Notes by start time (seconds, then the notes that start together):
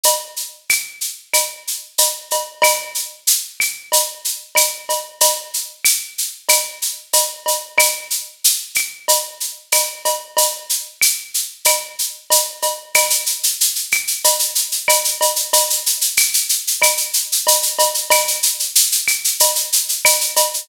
0.03 cowbell, shaker
0.36 shaker
0.69 claves, shaker
1.01 shaker
1.33 cowbell, claves, shaker
1.67 shaker
1.98 cowbell, shaker
2.31 cowbell, shaker
2.62 cowbell, claves, shaker
2.95 shaker
3.27 shaker
3.60 claves, shaker
3.92 cowbell, shaker
4.25 shaker
4.55 cowbell, claves, shaker
4.89 cowbell, shaker
5.21 cowbell, shaker
5.54 shaker
5.85 claves, shaker
6.18 shaker
6.49 cowbell, claves, shaker
6.82 shaker
7.13 cowbell, shaker
7.46 cowbell, shaker
7.78 cowbell, claves, shaker
8.10 shaker
8.44 shaker
8.75 claves, shaker
9.08 cowbell, shaker
9.40 shaker
9.72 cowbell, claves, shaker
10.05 cowbell, shaker
10.37 cowbell, shaker
10.69 shaker
11.01 claves, shaker
11.34 shaker
11.65 cowbell, claves, shaker
11.99 shaker
12.30 cowbell, shaker
12.62 cowbell, shaker
12.95 cowbell, claves, shaker
13.10 shaker
13.26 shaker
13.43 shaker
13.61 shaker
13.75 shaker
13.92 claves, shaker
14.07 shaker
14.24 cowbell, shaker
14.39 shaker
14.55 shaker
14.72 shaker
14.88 cowbell, claves, shaker
15.04 shaker
15.21 cowbell, shaker
15.36 shaker
15.53 cowbell, shaker
15.70 shaker
15.86 shaker
16.01 shaker
16.17 claves, shaker
16.34 shaker
16.49 shaker
16.67 shaker
16.82 cowbell, claves, shaker
16.97 shaker
17.13 shaker
17.32 shaker
17.47 cowbell, shaker
17.62 shaker
17.79 cowbell, shaker
17.94 shaker
18.10 cowbell, claves, shaker
18.28 shaker
18.43 shaker
18.60 shaker
18.76 shaker
18.92 shaker
19.08 claves, shaker
19.24 shaker
19.40 cowbell, shaker
19.55 shaker
19.72 shaker
19.89 shaker
20.05 cowbell, claves, shaker
20.21 shaker
20.36 cowbell, shaker
20.54 shaker